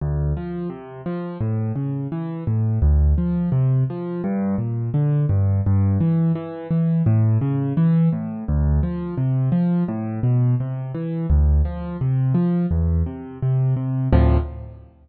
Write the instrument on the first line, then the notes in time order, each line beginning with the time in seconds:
acoustic grand piano
0.01 D2
0.37 F3
0.70 C3
1.06 F3
1.41 A2
1.76 C#3
2.12 E3
2.47 A2
2.82 D2
3.18 F3
3.52 C3
3.90 F3
4.24 G2
4.58 A#2
4.94 D3
5.29 G2
5.66 G2
6.00 E3
6.35 E3
6.71 E3
7.06 A2
7.41 C#3
7.77 E3
8.12 A2
8.48 D2
8.83 F3
9.17 C3
9.52 F3
9.88 A2
10.23 B2
10.60 C3
10.95 E3
11.30 D2
11.65 F3
12.01 C3
12.34 F3
12.71 E2
13.06 C3
13.42 C3
13.77 C3
14.12 D2 A2 C3 F3